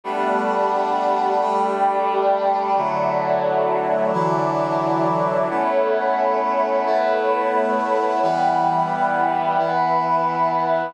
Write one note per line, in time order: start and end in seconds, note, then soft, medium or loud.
0.04 1.39 G3 medium
0.04 1.39 A3 medium
0.04 1.39 B3 medium
0.04 1.39 D4 medium
0.04 1.39 G4 medium
0.04 1.39 D5 medium
0.04 1.39 A5 medium
0.04 1.39 B5 medium
1.40 2.75 G3 medium
1.40 2.75 A3 medium
1.40 2.75 D4 medium
1.40 2.75 G4 medium
1.40 2.75 D5 medium
1.40 2.75 G5 medium
1.40 2.75 B5 medium
2.77 4.12 D3 medium
2.77 4.12 F#3 medium
2.77 4.12 A3 medium
2.77 4.12 E4 medium
2.77 4.12 D5 medium
2.77 4.12 E5 medium
2.77 4.12 F#5 medium
2.77 4.12 A5 medium
4.13 5.48 D3 medium
4.13 5.48 E3 medium
4.13 5.48 F#3 medium
4.13 5.48 E4 medium
4.13 5.48 D5 medium
4.13 5.48 E5 medium
4.13 5.48 A5 medium
4.13 5.48 D6 medium
5.49 6.85 A3 medium
5.49 6.85 B3 medium
5.49 6.85 C#4 medium
5.49 6.85 E4 medium
5.49 6.84 A4 medium
5.49 6.84 C#5 medium
5.49 6.84 E5 medium
5.49 6.84 B5 medium
6.85 8.20 A3 medium
6.85 8.20 B3 medium
6.85 8.20 E4 medium
6.85 8.20 A4 medium
6.85 8.21 A4 medium
6.85 8.21 B4 medium
6.85 8.21 C#5 medium
6.85 8.21 B5 medium
8.22 9.57 E3 medium
8.22 9.57 G3 medium
8.22 9.57 B3 medium
8.22 9.57 E5 medium
8.22 9.57 G5 medium
8.22 9.57 B5 medium
9.58 10.93 E3 medium
9.58 10.93 B3 medium
9.58 10.93 E4 medium
9.58 10.93 B4 medium
9.58 10.93 E5 medium
9.58 10.93 B5 medium